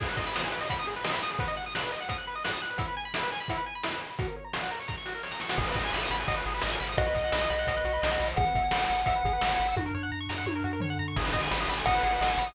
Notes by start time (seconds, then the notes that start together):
0.00 G#4, kick, crash
0.09 B4
0.17 D#5, kick
0.27 B5
0.35 D#6, snare
0.44 G#4
0.52 B4
0.61 D#5
0.70 B5, kick, closed hi-hat
0.79 D#6
0.87 G#4
0.96 B4
1.04 D#5, snare
1.13 B5
1.23 D#6
1.31 G#4
1.39 B4, kick, closed hi-hat
1.48 D#5
1.57 F#5
1.66 D#6
1.75 F#6, snare
1.83 B4
1.92 D#5
2.00 F#5
2.09 D#6, kick, closed hi-hat
2.18 F#6
2.27 B4
2.35 D#5
2.44 F#5, snare
2.53 D#6
2.62 F#6
2.70 B4
2.78 E4, kick, closed hi-hat
2.88 B4
2.97 G#5
3.05 B5
3.14 E4, snare
3.23 B4
3.32 G#5
3.40 B5
3.48 E4, kick, closed hi-hat
3.57 B4
3.66 G#5
3.75 B5
3.83 E4, snare
3.92 B4
4.01 G#5
4.10 B5
4.19 F#4, kick, closed hi-hat
4.28 A#4
4.36 C#5
4.44 A#5
4.53 C#6, snare
4.63 F#4
4.71 A#4
4.80 C#5
4.88 A#5, kick, snare
4.98 C#6
5.05 F#4, snare
5.15 A#4
5.23 C#5, snare
5.31 A#5, snare
5.40 C#6, snare
5.49 F#4, snare
5.58 G#1 G#4, kick, crash
5.68 B4
5.75 G#1 D#5, kick, closed hi-hat
5.85 G#5
5.93 G#1 B5, snare
6.02 D#6
6.10 G#1 B5, closed hi-hat
6.19 G#5
6.28 G#1 D#5, kick, closed hi-hat
6.37 B4
6.45 G#1 G#4, closed hi-hat
6.54 B4
6.62 G#1 D#5, snare
6.71 G#5
6.80 G#1 B5, open hi-hat
6.89 D#6
6.97 B1 F#4 D#5, kick, closed hi-hat
7.06 B4
7.15 B1 D#5, kick, closed hi-hat
7.24 F#5
7.32 B1 B5, snare
7.41 D#6
7.50 B1 B5, closed hi-hat
7.59 F#5
7.67 B1 D#5, kick, closed hi-hat
7.76 B4
7.84 B1 F#4, closed hi-hat
7.93 B4
8.02 B1 D#5, snare
8.11 F#5
8.19 B1 B5, open hi-hat
8.28 D#6
8.36 G#1 G#4 F#5, kick, closed hi-hat
8.46 B4
8.55 G#1 E5, kick, closed hi-hat
8.63 G#5
8.71 G#1 B5, snare
8.81 E6
8.90 G#1 B5, closed hi-hat
8.98 G#5
9.06 G#1 E5, kick, closed hi-hat
9.15 B4
9.24 G#1 G#4, kick, closed hi-hat
9.33 B4
9.41 G#1 E5, snare
9.50 G#5
9.59 G#1 B5, closed hi-hat
9.68 E6
9.76 F#2 F#4, kick, high tom
9.86 A#4
9.94 F#2 C#5
10.03 F#5
10.12 F#2 A#5
10.20 C#6
10.29 F#2 A#5, snare
10.38 F#5
10.46 F#2 C#5, high tom
10.55 A#4
10.64 F#2 F#4
10.73 A#4
10.80 F#2 C#5, floor tom
10.90 F#5
10.99 F#2 A#5
11.08 C#6
11.16 G#1 G#4, kick, crash
11.25 B4
11.33 G#1 D#5, kick, closed hi-hat
11.43 G#5
11.51 G#1 B5, snare
11.60 D#6
11.68 G#1 B5, closed hi-hat
11.77 G#5
11.86 G#1 D#5 F#5, kick, closed hi-hat
11.95 B4
12.03 G#1 G#4, closed hi-hat
12.12 B4
12.21 G#1 D#5, snare
12.30 G#5
12.37 G#1 B5, closed hi-hat
12.47 D#6